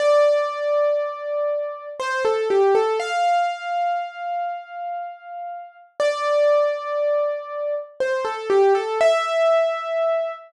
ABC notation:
X:1
M:3/4
L:1/16
Q:1/4=60
K:F
V:1 name="Acoustic Grand Piano"
d8 c A G A | f12 | d8 c A G A | e6 z6 |]